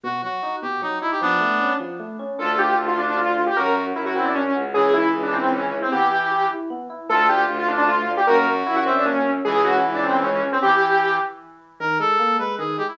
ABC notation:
X:1
M:3/4
L:1/16
Q:1/4=153
K:Glyd
V:1 name="Lead 2 (sawtooth)"
z12 | z12 | [K:Clyd] A2 G2 z =F D D F3 G | ^A2 z2 E F C D ^C3 z |
_A2 _F2 z D C C _D3 C | G6 z6 | A2 G2 z =F D D F3 G | ^A2 z2 E F C D ^C3 z |
_A2 F2 z D C C _D3 C | G6 z6 | [K:Glyd] z12 |]
V:2 name="Brass Section"
F2 F4 G2 ^D2 E G | [B,D]6 z6 | [K:Clyd] =F12 | F3 z3 E2 z4 |
_F,12 | E,6 z6 | =F12 | F6 e2 z4 |
_F,12 | E,6 z6 | [K:Glyd] _B2 A4 =B2 _A2 G E |]
V:3 name="Electric Piano 1"
B,,2 F,2 ^D2 B,,2 F,2 D2 | =F,2 A,2 C2 F,2 A,2 C2 | [K:Clyd] D2 =F2 A2 F2 D2 F2 | ^C2 F2 ^A2 F2 C2 F2 |
_D2 _F2 _A2 F2 D2 F2 | B,2 E2 G2 E2 B,2 E2 | A,2 D2 =F2 D2 A,2 D2 | ^A,2 ^C2 F2 C2 A,2 C2 |
_A,2 _D2 _F2 D2 A,2 D2 | z12 | [K:Glyd] _E,2 _A,2 _B,2 A,2 E,2 A,2 |]
V:4 name="Violin" clef=bass
z12 | z12 | [K:Clyd] D,,4 D,,8 | F,,4 F,,6 _D,,2- |
_D,,4 D,,8 | z12 | D,,4 D,,8 | F,,4 F,,8 |
_D,,4 D,,8 | z12 | [K:Glyd] z12 |]